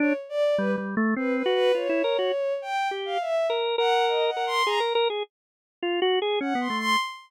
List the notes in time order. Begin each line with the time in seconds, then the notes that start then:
0.00 D4 C#5
0.29 D5
0.58 G3 B4
0.78 G3
0.97 A3
1.16 C4 B4
1.36 B4
1.46 F#4
1.55 B4
1.75 F4 C#5
1.89 E4
2.04 A#4
2.19 F#4
2.62 G5
2.91 G4
3.05 F5
3.21 E5
3.50 A#4
3.78 A#4 F#5
4.08 D#5
4.27 F#5
4.37 A#4
4.46 C6
4.66 G#4 A#5
4.80 A#4
4.95 A#4
5.10 G#4
5.83 F4
6.02 F#4
6.22 G#4
6.41 C#4 F#5
6.55 B3
6.60 C6
6.70 A3
6.79 C6